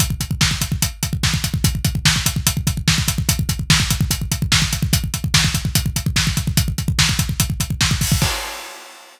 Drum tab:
CC |----------------|----------------|----------------|----------------|
HH |x-x---x-x-x---x-|x-x---x-x-x---x-|x-x---x-x-x---x-|x-x---x-x-x---x-|
SD |----o-------o---|----o-------o---|----o-------o---|----o-------o---|
BD |ooooooooo-oooooo|oooooooooooooooo|oooooooooooooooo|oooooooooooooooo|

CC |----------------|x---------------|
HH |x-x---x-x-x---o-|----------------|
SD |----o-------o---|----------------|
BD |oooooooooooooooo|o---------------|